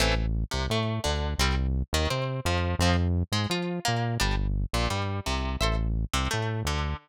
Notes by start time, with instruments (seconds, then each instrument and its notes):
0.00 synth bass 1 A1, acoustic guitar (steel) E3 A3 C4
0.51 synth bass 1 C2, acoustic guitar (steel) C3
0.70 synth bass 1 A2, acoustic guitar (steel) A3
1.04 synth bass 1 D2, acoustic guitar (steel) D3
1.38 synth bass 1 C2, acoustic guitar (steel) G3 C4
1.93 synth bass 1 D#2, acoustic guitar (steel) D#3
2.10 synth bass 1 C3, acoustic guitar (steel) C4
2.45 synth bass 1 F2, acoustic guitar (steel) F3
2.79 synth bass 1 F2, acoustic guitar (steel) F3 C4
3.32 synth bass 1 G#2, acoustic guitar (steel) G#3
3.50 synth bass 1 F3, acoustic guitar (steel) F4
3.85 synth bass 1 A#2, acoustic guitar (steel) A#3
4.20 synth bass 1 G1, acoustic guitar (steel) G3 D4
4.73 synth bass 1 A#1, acoustic guitar (steel) A#2
4.90 synth bass 1 G2, acoustic guitar (steel) G3
5.26 synth bass 1 C2, acoustic guitar (steel) C3
5.61 synth bass 1 A1, acoustic guitar (steel) A4 C5 E5
6.13 synth bass 1 C2, acoustic guitar (steel) C3
6.31 synth bass 1 A2, acoustic guitar (steel) A3
6.65 synth bass 1 D2, acoustic guitar (steel) D3